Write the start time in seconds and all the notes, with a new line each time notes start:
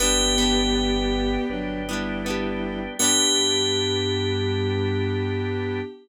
0.00 G1 B3 D4 G4 B4 D5 G5
0.04 G4
0.38 B3 D4
0.42 G4
0.75 B4 D5 G5
1.50 G1 F#3 D4 B4 D5 G5
1.88 G3 B3 D4 E4
1.93 G4
2.24 B3 D4 B4 D5 G5
2.30 G4
2.99 G2 B3 D4 G4
3.04 G4